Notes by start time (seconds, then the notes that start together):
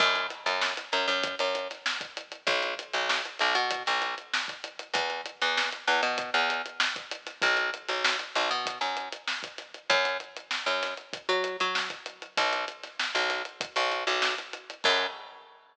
0.00 F#2, kick, crash
0.15 closed hi-hat
0.30 snare, closed hi-hat
0.46 F#2, closed hi-hat
0.61 snare
0.77 snare, closed hi-hat
0.92 F#2, snare, closed hi-hat
1.08 F#2, closed hi-hat
1.23 kick, closed hi-hat
1.39 F#2, closed hi-hat
1.55 closed hi-hat
1.70 snare, closed hi-hat
1.86 snare
2.01 kick, closed hi-hat
2.17 closed hi-hat
2.32 closed hi-hat
2.47 B1, kick, closed hi-hat
2.63 closed hi-hat
2.79 closed hi-hat
2.93 B1, closed hi-hat
3.09 snare
3.25 closed hi-hat
3.39 B1, snare, closed hi-hat
3.55 B2, snare, closed hi-hat
3.71 kick, closed hi-hat
3.86 B1, snare, closed hi-hat
4.02 snare, closed hi-hat
4.18 closed hi-hat
4.34 snare
4.48 kick, closed hi-hat
4.64 closed hi-hat
4.79 closed hi-hat
4.94 E2, kick, closed hi-hat
5.10 closed hi-hat
5.26 closed hi-hat
5.41 E2, closed hi-hat
5.57 snare
5.72 closed hi-hat
5.88 E2, snare, closed hi-hat
6.03 B2, closed hi-hat
6.18 kick, closed hi-hat
6.34 E2, closed hi-hat
6.50 closed hi-hat
6.66 closed hi-hat
6.80 snare
6.96 kick, closed hi-hat
7.11 closed hi-hat
7.27 snare, closed hi-hat
7.42 B1, kick, closed hi-hat
7.57 closed hi-hat
7.74 closed hi-hat
7.88 B1, snare, closed hi-hat
8.05 snare
8.19 closed hi-hat
8.35 B1, snare, closed hi-hat
8.51 B2, closed hi-hat
8.66 kick, closed hi-hat
8.81 F#2, closed hi-hat
8.97 closed hi-hat
9.12 closed hi-hat
9.28 snare
9.43 kick, closed hi-hat
9.58 snare, closed hi-hat
9.74 closed hi-hat
9.90 F#2, kick, closed hi-hat
10.05 closed hi-hat
10.20 closed hi-hat
10.36 closed hi-hat
10.51 snare
10.66 F#2, closed hi-hat
10.82 snare, closed hi-hat
10.97 closed hi-hat
11.13 kick, closed hi-hat
11.29 F#3, closed hi-hat
11.44 closed hi-hat
11.60 F#3, closed hi-hat
11.75 snare
11.90 kick, closed hi-hat
12.06 closed hi-hat
12.22 closed hi-hat
12.37 B1, kick, closed hi-hat
12.53 closed hi-hat
12.68 closed hi-hat
12.83 snare, closed hi-hat
12.99 snare
13.15 B1, closed hi-hat
13.30 snare, closed hi-hat
13.45 closed hi-hat
13.61 kick, closed hi-hat
13.76 B1, snare, closed hi-hat
13.92 closed hi-hat
14.07 B1, closed hi-hat
14.22 snare
14.38 snare, closed hi-hat
14.53 closed hi-hat
14.70 closed hi-hat
14.84 F#2, kick, crash